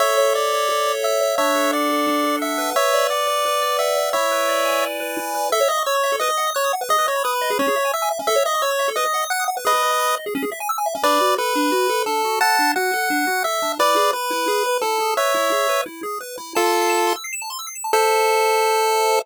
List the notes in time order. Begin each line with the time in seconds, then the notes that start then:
0.00 A4 C#5 E5
0.17 C#5
0.34 D5 E5
0.52 C#5
0.69 A4
0.86 C#5
1.03 E5
1.21 C#5
1.38 D4 C#5 E5
1.55 A4
1.72 D5 F#5
1.90 A4
2.07 D4
2.24 A4
2.41 E5 F#5
2.58 B4
2.76 C#5 E5
2.93 D5
3.10 D5 F#5
3.27 D5
3.45 B4
3.62 D5
3.79 E5 F#5
3.97 D5
4.13 E4 C#5 E5
4.31 B4
4.48 D5
4.65 G#5
4.82 D5
5.00 B4
5.17 E4
5.34 B4
5.52 A4 E5
5.60 C#5
5.68 D#5 E5
5.78 C#6
5.86 C#5 E6
5.95 C#6
6.03 E5
6.12 A4
6.20 B4 D#5
6.29 D#5
6.38 F#5
6.47 D#6
6.55 C#5 F#6
6.64 D#6
6.73 F#5
6.81 B4
6.89 G#4 D#5
6.98 B4
7.06 C#5 D#5
7.16 B5
7.24 B4 D#6
7.33 B5
7.41 D#5
7.50 G#4
7.59 C#4 C#5
7.68 G#4
7.76 E5
7.85 G#5
7.94 E5 E6
8.02 G#5
8.11 E5
8.19 C#4
8.27 A4 E5
8.36 C#5
8.45 D#5 E5
8.54 C#6
8.62 C#5 E6
8.71 C#6
8.79 E5
8.88 A4
8.96 B4 D#5
9.05 D#5
9.14 F#5
9.22 D#6
9.30 F#5 F#6
9.40 D#6
9.48 F#5
9.57 B4
9.65 G#4 B4 D#5
9.74 B4
9.83 D#5
9.91 B5
9.99 D#6
10.08 B5
10.17 D#5
10.26 G#4
10.35 C#4
10.43 G#4
10.52 E5
10.60 G#5
10.69 E6
10.78 G#5
10.86 E5
10.95 C#4
11.03 D4 B4 D5
11.21 F#4
11.38 A4 B4
11.55 D4
11.72 F#4
11.89 A4
12.06 D4 A4
12.24 F#4
12.41 A4 F#5 A5
12.59 D4
12.76 F#4 F#5
12.93 A4
13.10 D4
13.27 F#4
13.44 A4 E5
13.62 D4
13.79 E4 B4 D5
13.96 G#4
14.13 B4
14.30 E4
14.48 G#4
14.66 B4
14.82 E4 A4
15.00 G#4
15.17 B4 C#5 E5
15.34 E4
15.52 G#4
15.69 B4
15.86 E4
16.03 G#4
16.21 B4
16.38 E4
16.55 F4 A4 A5
16.64 C6
16.73 E6
16.81 C7
16.89 E7
16.98 A5
17.07 C6
17.16 E6
17.24 C7
17.33 E7
17.42 A5
17.50 C6
17.59 E6
17.67 C7
17.75 E7
17.84 A5
17.93 A4 C5 E5